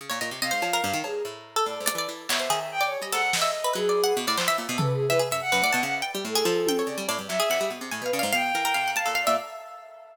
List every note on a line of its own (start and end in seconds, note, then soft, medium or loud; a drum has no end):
0.01 0.10 C#3 medium
0.10 0.20 A#2 medium
0.10 0.19 C#5 medium
0.21 0.31 A#2 medium
0.21 0.30 D#5 medium
0.31 0.41 C3 medium
0.42 0.51 C3 medium
0.42 0.51 D#5 loud
0.42 0.98 F5 medium
0.51 0.62 G#2 medium
0.51 0.60 C5 medium
0.62 0.81 F3 loud
0.62 cowbell medium
0.73 0.83 A#4 loud
0.84 0.93 G2 loud
0.93 1.03 D#3 loud
1.04 1.22 G2 medium
1.04 1.23 G#4 medium
1.04 cowbell medium
1.25 1.62 A2 medium
1.56 1.66 A4 medium
1.65 1.79 A2 medium
1.65 1.83 D5 medium
1.80 1.93 G#2 medium
1.86 1.95 D5 medium
1.86 2.08 D5 medium
1.86 closed hi-hat loud
1.95 2.07 E3 medium
1.95 2.08 D5 medium
2.09 2.27 E3 medium
2.29 2.48 B2 loud
2.29 2.40 C#5 loud
2.29 2.66 E5 medium
2.29 clap loud
2.39 2.49 C5 medium
2.50 2.97 D#3 medium
2.50 2.59 G#4 loud
2.72 2.84 G5 loud
2.81 2.90 D5 medium
2.85 2.98 C#5 loud
2.98 3.11 G3 medium
2.98 3.11 G4 medium
3.02 3.12 D#5 medium
3.12 3.69 G#2 medium
3.12 3.22 A4 loud
3.12 3.30 F#5 loud
3.12 closed hi-hat medium
3.33 3.72 D#5 medium
3.33 snare medium
3.42 3.51 E5 medium
3.64 3.73 B4 medium
3.73 4.13 F#3 loud
3.73 4.13 G#4 loud
3.73 3.86 B4 medium
3.89 4.02 D5 medium
4.04 4.16 F#5 loud
4.17 4.26 B2 loud
4.27 4.37 A2 loud
4.27 4.37 D5 loud
4.38 4.47 F3 medium
4.38 4.47 C5 medium
4.38 clap medium
4.48 4.57 E3 medium
4.48 4.57 E5 loud
4.58 4.67 A#2 medium
4.69 4.78 B2 loud
4.78 5.07 C#3 medium
4.78 4.87 A4 medium
4.78 4.92 B4 medium
4.78 floor tom loud
4.93 5.06 G#4 medium
5.07 5.20 E3 medium
5.07 5.20 B4 loud
5.07 5.19 E5 loud
5.19 5.29 G#4 medium
5.31 5.41 F#2 medium
5.31 5.41 E5 loud
5.41 5.79 F#5 loud
5.52 5.62 F#2 loud
5.52 5.61 B4 medium
5.62 5.71 A2 medium
5.62 5.73 D5 loud
5.73 5.83 B2 loud
5.73 6.01 A5 medium
5.83 6.02 C#3 loud
5.83 5.94 F#5 loud
6.02 6.12 G5 medium
6.15 6.24 G3 loud
6.25 6.43 A2 medium
6.25 6.83 A4 medium
6.35 6.45 G#4 loud
6.45 6.83 F3 loud
6.45 6.55 A4 medium
6.67 6.78 G5 loud
6.67 high tom medium
6.79 6.88 C#5 soft
6.86 6.96 C#3 medium
6.86 7.05 D5 medium
6.98 7.07 G3 loud
7.08 7.18 A2 loud
7.08 7.18 D5 medium
7.08 cowbell medium
7.18 7.28 G2 medium
7.28 7.39 F#3 loud
7.28 7.65 E5 loud
7.28 clap medium
7.40 7.49 G#4 loud
7.50 7.59 F2 medium
7.50 7.60 F#5 loud
7.50 clap medium
7.61 7.70 G3 medium
7.70 7.80 B2 medium
7.81 7.90 C3 medium
7.91 8.02 A2 medium
7.91 8.04 G#5 medium
8.02 8.11 B2 medium
8.02 8.11 B4 loud
8.06 8.18 F5 medium
8.13 8.23 C#3 loud
8.13 8.23 D5 medium
8.19 8.32 G#2 loud
8.19 8.32 F5 loud
8.33 8.52 B2 medium
8.33 8.42 F5 loud
8.33 8.90 G5 loud
8.54 8.73 E3 medium
8.54 8.64 A#4 medium
8.65 8.74 A#4 loud
8.74 9.03 C3 medium
8.74 8.84 F5 medium
8.88 8.97 F#5 medium
8.96 9.08 F5 medium
8.96 9.06 A5 loud
8.96 closed hi-hat medium
9.06 9.25 A#2 medium
9.06 9.15 A4 medium
9.06 9.20 F5 medium
9.15 9.24 F5 loud
9.23 9.35 D5 loud
9.27 9.37 A#2 medium
9.27 9.36 E5 loud